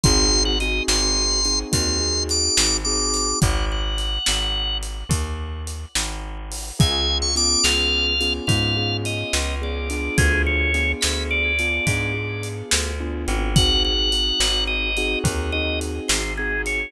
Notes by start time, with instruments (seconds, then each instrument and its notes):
0.03 electric bass (finger) G#1, acoustic grand piano C4 D#4 F#4 G#4, drawbar organ C6, kick, closed hi-hat
0.45 drawbar organ F#5
0.60 acoustic grand piano C4 D#4 F#4 G#4, drawbar organ D#5, closed hi-hat
0.88 electric bass (finger) G#1, drawbar organ C6, snare
1.45 acoustic grand piano C4 D#4 F#4 G#4, closed hi-hat
1.72 electric bass (finger) D#2, acoustic grand piano C4 D#4 F#4 G#4, drawbar organ C6, kick, closed hi-hat
2.00 acoustic grand piano C4 D#4 F#4 G#4
2.29 drawbar organ D6, closed hi-hat
2.57 electric bass (finger) G#1, snare
2.85 acoustic grand piano C4 D#4 F#4 G#4, drawbar organ D6
3.14 closed hi-hat
3.41 electric bass (finger) G#1, drawbar organ F#5, kick, closed hi-hat
3.72 drawbar organ F#5
3.98 closed hi-hat
4.26 electric bass (finger) G#1, snare
4.83 closed hi-hat
5.09 electric bass (finger) D#2, kick, closed hi-hat
5.67 closed hi-hat
5.95 electric bass (finger) G#1, snare
6.52 open hi-hat
6.79 electric bass (finger) C#2, acoustic grand piano B3 C#4 F4 G#4, drawbar organ G#5, kick, closed hi-hat
7.22 drawbar organ C#6
7.36 acoustic grand piano B3 C#4 F4 G#4, drawbar organ D6, closed hi-hat
7.64 electric bass (finger) C#2, drawbar organ F5, snare
8.20 acoustic grand piano B3 C#4 F4 G#4, closed hi-hat
8.47 electric bass (finger) G#2, acoustic grand piano B3 C#4 F4 G#4, drawbar organ F5, kick, closed hi-hat
8.76 acoustic grand piano B3 C#4 F4 G#4
9.05 drawbar organ D#5, closed hi-hat
9.33 electric bass (finger) C#2, snare
9.62 acoustic grand piano B3 C#4 F4 G#4, drawbar organ D5
9.90 acoustic grand piano B3 D4 F4 G#4, closed hi-hat
10.18 electric bass (finger) D2, drawbar organ G#4, kick, closed hi-hat
10.46 drawbar organ C#5
10.74 acoustic grand piano B3 D4 F4 G#4, closed hi-hat
11.01 electric bass (finger) D2, drawbar organ B5, snare
11.31 drawbar organ D5
11.59 acoustic grand piano B3 D4 F4 G#4, closed hi-hat
11.87 electric bass (finger) G#2, acoustic grand piano B3 D4 F4 G#4, kick, closed hi-hat
12.14 acoustic grand piano B3 D4 F4 G#4
12.43 closed hi-hat
12.71 electric bass (finger) D2, snare
13.00 acoustic grand piano B3 D4 F4 G#4
13.28 electric bass (finger) G#1, closed hi-hat
13.56 acoustic grand piano C4 D#4 F#4 G#4, drawbar organ F#5, kick, closed hi-hat
13.85 drawbar organ F#5
14.12 acoustic grand piano C4 D#4 F#4 G#4, closed hi-hat
14.40 electric bass (finger) G#1, snare
14.67 drawbar organ D#5
14.97 acoustic grand piano C4 D#4 F#4 G#4, closed hi-hat
15.24 electric bass (finger) D#2, acoustic grand piano C4 D#4 F#4 G#4, kick, closed hi-hat
15.52 acoustic grand piano C4 D#4 F#4 G#4, drawbar organ D#5
15.81 closed hi-hat
16.08 electric bass (finger) G#1, drawbar organ C5, snare
16.37 acoustic grand piano C4 D#4 F#4 G#4, drawbar organ G#4
16.66 drawbar organ C#5, closed hi-hat